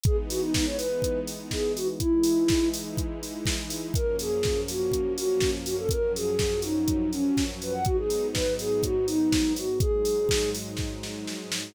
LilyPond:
<<
  \new Staff \with { instrumentName = "Ocarina" } { \time 4/4 \key gis \minor \tempo 4 = 123 gis'16 r16 fis'16 dis'16 dis'16 cis''16 b'4 r8 gis'8 fis'16 r16 | e'4. r2 r8 | ais'8 gis'4 fis'4 fis'8. r16 fis'16 a'16 | ais'8 gis'4 dis'4 cis'8. r16 b'16 fis''16 |
fis'16 gis'8. b'8 gis'8 fis'8 dis'4 fis'8 | gis'4. r2 r8 | }
  \new Staff \with { instrumentName = "String Ensemble 1" } { \time 4/4 \key gis \minor <e gis b dis'>1 | <e gis dis' e'>1 | <fis, eis ais cis'>1 | <fis, eis fis cis'>1 |
<gis, fis b dis'>1 | <gis, fis gis dis'>1 | }
  \new DrumStaff \with { instrumentName = "Drums" } \drummode { \time 4/4 <hh bd>8 hho8 <bd sn>8 hho8 <hh bd>8 hho8 <bd sn>8 hho8 | <hh bd>8 hho8 <bd sn>8 hho8 <hh bd>8 hho8 <bd sn>8 hho8 | <hh bd>8 hho8 <bd sn>8 hho8 <hh bd>8 hho8 <bd sn>8 hho8 | <hh bd>8 hho8 <bd sn>8 hho8 <hh bd>8 hho8 <bd sn>8 hho8 |
<hh bd>8 hho8 <bd sn>8 hho8 <hh bd>8 hho8 <bd sn>8 hho8 | <hh bd>8 hho8 <bd sn>8 hho8 <bd sn>8 sn8 sn8 sn8 | }
>>